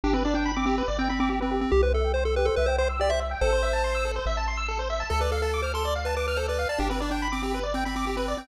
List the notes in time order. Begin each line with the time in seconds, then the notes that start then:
0.04 G1 D4 G4
0.13 C4 B4
0.25 D4 D5
0.34 D4 G5
0.45 B5
0.56 C4 D6
0.66 C4 G4
0.78 B4
0.88 G1 D5
0.99 C4 G5
1.09 C4 B5
1.20 C4 D6
1.30 C4 G4
1.40 C4 B4
1.51 G4
1.61 C4
1.72 C2 G4
1.83 B4 C5
1.93 A4 E5
2.04 G5
2.14 C5 C6
2.25 A4 E6
2.36 G4 B4
2.45 A4 C5
2.56 C2 B4 E5
2.66 C5 G5
2.78 C5 C6
2.89 E6
2.99 G4 D5
3.10 C5 E5
3.20 E5
3.31 G5
3.41 A1 A4 C5
3.52 C5
3.62 E5
3.73 A5
3.84 C6
3.95 E6
4.05 A4
4.16 C5
4.26 A1 E5
4.37 A5
4.47 C6
4.57 E6
4.68 A4
4.79 C5
4.90 E5
5.00 A5
5.10 D2 A4
5.21 B4 D5
5.32 A4 F5
5.42 A4 A5
5.54 D6
5.62 C5 F6
5.74 A4 C6
5.85 D5
5.95 F5
6.05 B4 A5
6.16 B4 D6
6.27 B4 F6
6.37 A4 C5
6.48 B4 D5
6.59 F5
6.69 D5 A5
6.78 G1 D4 G4
6.90 C4 B4
7.00 D4 D5
7.11 D4 G5
7.22 B5
7.32 C4 D6
7.43 C4 G4
7.54 B4
7.63 D5
7.74 C4 G5
7.85 C4 B5
7.96 C4 D6
8.06 C4 G4
8.17 C4 B4
8.28 D5
8.37 C4 G5